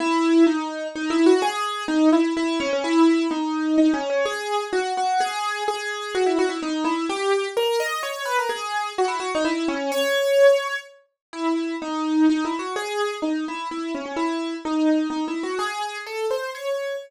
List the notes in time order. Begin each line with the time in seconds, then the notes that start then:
0.00 E4
0.47 D#4
0.95 D#4
1.10 E4
1.26 F#4
1.42 G#4
1.88 D#4
2.12 E4
2.37 E4
2.60 C#4
2.73 C#4
2.84 E4
3.31 D#4
3.78 D#4
3.94 C#4
4.10 C#4
4.25 G#4
4.73 F#4
4.97 F#4
5.20 G#4
5.68 G#4
6.15 F#4
6.26 E4
6.39 F#4
6.49 E4
6.63 D#4
6.84 E4
7.09 G4
7.57 A#4
7.80 D#5
8.03 C#5
8.25 B4
8.39 A#4
8.49 G#4
8.98 F#4
9.08 E4
9.20 F#4
9.35 D#4
9.45 E4
9.68 C#4
9.92 C#5
11.33 E4
11.82 D#4
12.30 D#4
12.45 E4
12.59 F#4
12.76 G#4
13.22 D#4
13.48 E4
13.71 E4
13.95 C#4
14.06 C#4
14.16 E4
14.65 D#4
15.10 D#4
15.28 E4
15.43 F#4
15.59 G#4
16.06 A4
16.31 C5
16.55 C#5